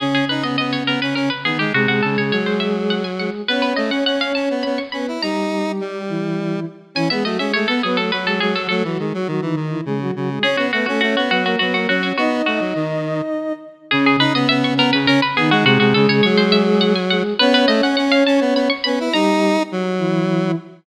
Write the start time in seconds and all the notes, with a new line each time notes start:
0.00 C#3 C#4 G#4
0.14 G#4
0.29 D#4 B4
0.43 B3 D#5
0.58 B3 D#5
0.73 C#5
0.86 B3 A#4
1.02 C#4 B4
1.15 C#4 A#4
1.30 B4
1.44 D#3 B3 D#4 G#4
1.59 G#3 G4
1.73 C3 G#3 F#4 G#4
1.87 C3 F#4
2.03 C#3 A4
2.18 C#3 C#5
2.31 F#3 C#5
2.46 C5
2.60 E5
2.90 F#5
3.04 G#5
3.18 G#3 G#4 F#5
3.48 B3 C#4 B4 C#5
3.62 B4
3.76 A3 D#5
3.90 C#4 F#5
4.06 C#4 F#5
4.21 F5
4.35 C#4 A5
4.50 B3
4.63 B3 B5
4.78 C#6
4.92 B3 C#4 B4 B5
5.08 E4
5.22 G3 D#4 G4 A#5
5.80 G3
6.09 E3 E4
6.95 E3 C#4 E4 G#5
7.10 G#3 B3 G#4 E5
7.24 F#3 A3 F#4 D#5
7.38 G#3 C#4 G#4 E5
7.54 G#3 A3 G#4 C#5
7.67 B3 A4 B4
7.83 F#3 B3 G#4 B4
7.97 A3 A4
8.11 F#3 F#4 B4
8.26 G#3 G#4 A4
8.40 F#3 G#3 G#4
8.54 F#3 F#4 A4
8.69 F#3 A3 A4
8.84 E3 F#3 F#4
8.99 D#3 G#3 G#4
9.13 F#3 F#4
9.27 D#3 F#3 F#4
9.42 D#3 E3 D#4
9.56 D#3 D#4
9.70 E3 E4
9.85 C#3 G#3 G#4
10.00 F#3 F#4
10.16 C#3 F#3 F#4
10.29 G#3 G#4
10.43 C#4 G#4 C#5
10.57 B3 F#4
10.73 A3 B3 F#4 B4
10.86 A3 C#4 F#4 A4
11.01 A3 C#4 F#4 C#5
11.17 B3 F#4
11.30 F#3 B3 F#4 B4
11.44 A#3 F#4 A#4
11.59 F#3 B3 F#4 B4
11.73 A#3 F#4 A#4
11.87 F#3 C#4 F#4 C#5
12.03 C#4 F#4 C#5
12.17 B3 D#4 F#4 D#5
12.46 A3 F#4
12.60 F#3
12.75 D#3
13.91 C#3 C#4 G#4
14.06 G#4
14.19 D#4 B4
14.34 B3 D#5
14.49 B3 E5
14.64 C#6
14.77 B3 A#4
14.93 C#3 B4
15.07 C#4 A#4
15.22 B4
15.36 D#3 B3 D#4 G#4
15.51 G#3 F#4
15.64 C3 G#3 F#4 G#4
15.80 C3 F#4
15.94 C#3 A4
16.08 C#3 C#5
16.23 F#3 C#5
16.37 C5
16.52 E5
16.81 F#5
16.95 G#5
17.10 G#3 G#4 F#5
17.38 B3 C#4 B4 C#5
17.54 B4
17.68 A3 D#5
17.82 C#4 F#5
17.97 C#4 F#5
18.12 F5
18.26 C#4 A5
18.41 B3
18.54 B3 B5
18.70 C#6
18.84 B3 C#4 B4 B5
19.00 E4
19.13 G3 D#4 G4 A#5
19.72 F#3
19.99 E3 E4